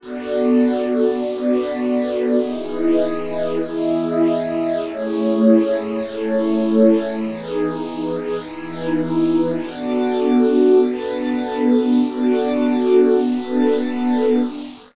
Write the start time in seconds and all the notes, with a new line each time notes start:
0.00 B3 D4 F#4 A4 D5
1.20 B3 D4 F#4 A4 B4 D5
2.40 E3 B3 D#4 E4 G#4 B4 D#5
3.60 E3 B3 E4 G#4 D#5 E5
4.80 A3 C#4 E4 G#4 C#5
5.99 A3 C#4 E4 G#4 A4 C#5
7.20 E3 B3 D#4 G#4 B4
8.40 E3 B3 D#4 E4 G#4 B4
9.60 B3 D4 F#4 A4 D5 A5
10.80 B3 D4 F#4 A4 B4 A5
12.00 B3 D4 F#4 A4 D5 A5
13.20 B3 D4 F#4 A4 B4 A5